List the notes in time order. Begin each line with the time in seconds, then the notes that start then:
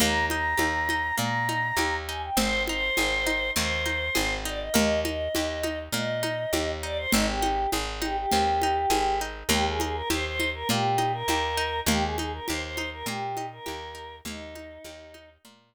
0.00 D#2 A#3 A#5, low conga
0.29 D#4 A#5, high conga
0.57 D#2 G4, high conga
0.89 D#4, high conga
1.18 A#2 A#3 A#5, low conga
1.49 D#4, high conga
1.77 D#2 G4, high conga
2.08 D#4 G#5
2.23 G5
2.37 G#1 C4 C5, low conga
2.67 D#4 C5, high conga
2.97 G#1 G#4, high conga
3.26 D#4, high conga
3.55 D#2 C4 C5, low conga
3.86 D#4, high conga
4.15 G#1 G#4, high conga
4.45 D#4 D5
4.60 D#5
4.74 D#2 A#3 D#5, low conga
5.05 D#4 D#5, high conga
5.35 D#2 G4, high conga
5.63 D#4, high conga
5.92 A#2 A#3 D#5, low conga
6.23 D#4, high conga
6.53 D#2 G4, high conga
6.83 D#4 D5
6.97 C5
7.12 G#1 C4 D#4, low conga
7.27 G4
7.42 D#4, high conga
7.72 G#1 G#4, high conga
8.02 D#4 G4, high conga
8.17 G4
8.32 D#2 C4, low conga
8.62 D#4, high conga
8.90 G#1 G#4, high conga
9.21 D#4
9.49 D#2 A#3 G4, low conga
9.67 G#4
9.80 D#4 G#4, high conga
9.95 A#4
10.10 D#2 G4 C5, high conga
10.25 C5
10.40 D#4, high conga
10.54 A#4
10.69 A#2 A#3 G4, low conga
10.98 D#4, high conga
11.12 A#4
11.28 D#2 G4, high conga
11.57 D#4
11.86 D#2 A#3 G4, low conga
12.02 G#4
12.17 D#4 G#4, high conga
12.33 A#4
12.48 D#2 G4 C5, high conga
12.62 C5
12.77 D#4, high conga
12.93 A#4
13.06 A#2 A#3 G4, low conga
13.37 D#4, high conga
13.52 A#4
13.66 D#2 G4, high conga
13.95 D#4
14.25 D#2 A#3 D#4, low conga
14.55 D#4, high conga
14.84 D#2 G4, high conga
15.14 D#4, high conga
15.45 A#2 A#3, low conga